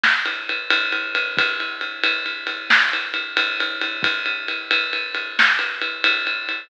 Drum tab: RD |-xxxxx|xxxxxx-xxxxx|xxxxxx-xxxxx|
SD |o-----|------o-----|------o-----|
BD |------|o-----------|o-----------|